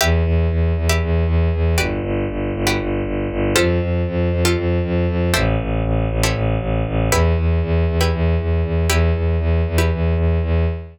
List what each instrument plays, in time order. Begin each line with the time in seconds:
0.01 violin E2, pizzicato strings G4 B4 E5
0.25 violin E2
0.51 violin E2
0.77 violin E2
0.89 pizzicato strings G4 B4 E5
1.02 violin E2
1.27 violin E2
1.54 violin E2
1.78 violin G1, pizzicato strings F#4 G4 B4 D5
2.03 violin G1
2.30 violin G1
2.54 violin G1
2.67 pizzicato strings F#4 G4 B4 D5
2.80 violin G1
3.05 violin G1
3.31 violin G1
3.56 violin F2, pizzicato strings F4 G4 A4 C5
3.80 violin F2
4.07 violin F2
4.32 violin F2
4.45 pizzicato strings F4 G4 A4 C5
4.56 violin F2
4.84 violin F2
5.08 violin F2
5.34 violin A1, pizzicato strings E4 G4 A4 C5
5.60 violin A1
5.84 violin A1
6.10 violin A1
6.23 pizzicato strings E4 G4 A4 C5
6.34 violin A1
6.60 violin A1
6.87 violin A1
7.11 violin E2, pizzicato strings E4 G4 B4
7.37 violin E2
7.63 violin E2
7.88 violin E2
8.01 pizzicato strings E4 G4 B4
8.13 violin E2
8.40 violin E2
8.64 violin E2
8.89 violin E2, pizzicato strings E4 G4 B4
9.15 violin E2
9.40 violin E2
9.67 violin E2
9.78 pizzicato strings E4 G4 B4
9.92 violin E2
10.16 violin E2
10.43 violin E2